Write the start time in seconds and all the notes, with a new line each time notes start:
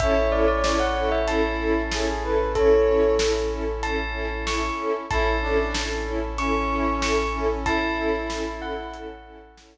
0.00 A1 C#4 E4 A4 C#5 E5, kick, closed hi-hat
0.32 C#4 E4 A4 D5
0.48 D5
0.64 C#4 E4 A4 D5, snare
0.80 F#5
0.97 C#4 E4 A4
1.12 E5
1.28 C#4 E4 A4 A5, closed hi-hat
1.59 C#4 E4 A4
1.91 C#4 E4 G#4 A4, snare
2.08 G#4
2.23 C#4 E4 A4 B4
2.55 C#4 E4 A4 C#5, kick, closed hi-hat
2.88 C#4 E4 A4
3.19 C#4 E4 A4, snare
3.51 C#4 E4 A4
3.83 C#4 E4 A4 A5, closed hi-hat
4.14 C#4 E4 A4
4.46 C#4 E4 A4 C#6, snare
4.79 C#4 E4 A4
5.10 A1 C#4 E4 A4 A5, kick, closed hi-hat
5.42 C#4 D4 E4 A4
5.74 C#4 E4 A4, snare
6.06 C#4 E4 A4
6.38 C#4 E4 A4 C#6, closed hi-hat
6.71 C#4 E4 A4
7.01 C#4 E4 A4 C#6, snare
7.34 C#4 E4 A4
7.65 C#4 E4 A4 A5, kick, closed hi-hat
7.97 C#4 E4 A4
8.30 C#4 E4 A4, snare
8.60 C#4 E4 A4 F#5
8.94 C#4 E4 A4, closed hi-hat
9.25 C#4 E4 A4
9.57 C#4 E4 A4, snare